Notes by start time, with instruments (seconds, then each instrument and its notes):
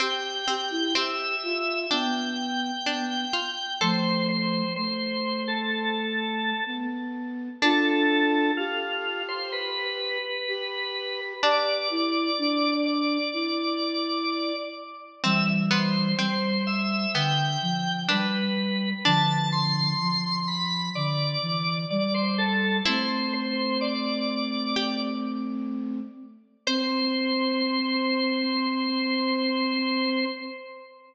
0.00 harpsichord C4, flute G4, drawbar organ G5
0.48 harpsichord C4, flute G4
0.71 flute E4
0.95 harpsichord C4, flute G4, drawbar organ E5
1.43 flute F4
1.90 flute B3, harpsichord D4, drawbar organ G5
2.85 flute B3, harpsichord D4
3.33 harpsichord F4
3.81 flute F3 A3, harpsichord A4, drawbar organ C5
4.29 drawbar organ C5
4.76 flute A3, drawbar organ C5
5.48 drawbar organ A4
6.66 flute B3
7.62 harpsichord D4, flute D4 F4, drawbar organ A4
8.57 drawbar organ F4, flute G4
9.28 drawbar organ C5
9.52 drawbar organ B4
10.48 flute G4
11.43 harpsichord D4, flute G4, drawbar organ D5
11.90 flute E4
12.38 flute D4
12.86 drawbar organ D5
13.33 flute E4
15.24 flute E3 G3, harpsichord C4, drawbar organ E5
15.71 harpsichord B3, drawbar organ C5
16.19 flute G3, harpsichord C4, drawbar organ C5
16.67 drawbar organ E5
17.14 flute D3, harpsichord B3, drawbar organ G5
17.62 flute F3
18.09 flute G3, harpsichord D4, drawbar organ B4
19.05 flute D3 F3, harpsichord D4, drawbar organ A5
19.52 drawbar organ C6
20.00 flute F3
20.48 drawbar organ B5
20.95 flute D3, drawbar organ D5
21.42 flute E3
21.90 flute G3, drawbar organ D5
22.14 drawbar organ C5
22.38 drawbar organ A4
22.86 flute A3 C4, harpsichord E4, drawbar organ C5
23.33 drawbar organ C5
23.81 drawbar organ D5
24.76 harpsichord G4
26.67 flute C4, drawbar organ C5, harpsichord C5